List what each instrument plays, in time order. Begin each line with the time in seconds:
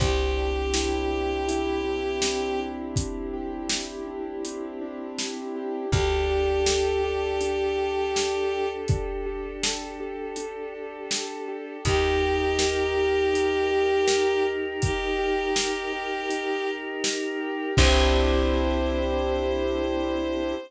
0.00 electric bass (finger) C2, acoustic grand piano C4, choir aahs C4 D4 E4 G4, violin G4, kick, closed hi-hat
0.37 acoustic grand piano D4
0.74 acoustic grand piano E4, snare
1.11 acoustic grand piano G4
1.48 acoustic grand piano E4, closed hi-hat
1.85 acoustic grand piano D4
2.22 acoustic grand piano C4, snare
2.59 acoustic grand piano D4
2.96 acoustic grand piano E4, kick, closed hi-hat
3.33 acoustic grand piano G4
3.69 acoustic grand piano E4, snare
4.07 acoustic grand piano D4
4.44 acoustic grand piano C4, closed hi-hat
4.81 acoustic grand piano D4
5.19 acoustic grand piano E4, snare
5.56 acoustic grand piano G4
5.92 electric bass (finger) D2, acoustic grand piano D4, choir aahs D4 G4 A4, violin G4, kick, closed hi-hat
6.30 acoustic grand piano G4
6.66 acoustic grand piano A4, snare
7.04 acoustic grand piano G4
7.41 acoustic grand piano D4, closed hi-hat
7.78 acoustic grand piano G4
8.15 acoustic grand piano A4, snare
8.52 acoustic grand piano G4
8.88 acoustic grand piano D4, kick, closed hi-hat
9.26 acoustic grand piano G4
9.63 acoustic grand piano A4, snare
10.00 acoustic grand piano G4
10.36 acoustic grand piano D4, closed hi-hat
10.74 acoustic grand piano G4
11.11 acoustic grand piano A4, snare
11.48 acoustic grand piano G4
11.85 electric bass (finger) D#2, acoustic grand piano D#4, choir aahs D#4 G4 A#4, violin G4, kick, closed hi-hat
12.22 acoustic grand piano G4
12.59 acoustic grand piano A#4, snare
12.96 acoustic grand piano G4
13.33 acoustic grand piano D#4, closed hi-hat
13.70 acoustic grand piano G4
14.07 acoustic grand piano A#4, snare
14.44 acoustic grand piano G4
14.81 acoustic grand piano D#4, violin G4, kick, closed hi-hat
15.19 acoustic grand piano G4
15.56 acoustic grand piano A#4, snare
15.93 acoustic grand piano G4
16.30 acoustic grand piano D#4, closed hi-hat
16.67 acoustic grand piano G4
17.04 acoustic grand piano A#4, snare
17.41 acoustic grand piano G4
17.77 electric bass (finger) C2, acoustic grand piano C4 D4 E4 G4, choir aahs C4 D4 E4 G4, violin C5, kick, crash